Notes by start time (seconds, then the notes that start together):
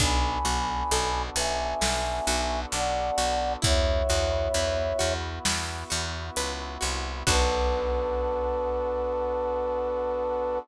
0.00 B1 B3 D4 F#4 A4 G#5 B5, kick, closed hi-hat
0.45 B1 F#4, closed hi-hat
0.91 B1 A4, closed hi-hat
1.36 B1 B4 E5 G#5, closed hi-hat
1.81 B1 A4, snare
2.27 B1 F#4, closed hi-hat
2.72 B1 D4 D5 F#5, closed hi-hat
3.18 B1 F#4, closed hi-hat
3.62 E2 B3 E4 F#4 C#5 E5, kick, closed hi-hat
4.09 E2 F#4, closed hi-hat
4.54 E2 B4, closed hi-hat
4.99 E2 F#4, closed hi-hat
5.45 E2 E4, snare
5.90 E2 F#4, closed hi-hat
6.36 C#2 B4, closed hi-hat
6.81 C2 F#4, closed hi-hat
7.27 B1 B3 D4 F#4 A4 B4, kick, crash